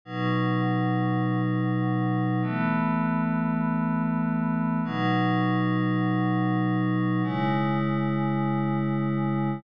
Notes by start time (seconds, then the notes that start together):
0.05 B2 F#3 D#4
2.42 E3 A3 B3
4.85 B2 F#3 D#4
7.23 C#3 G#3 E4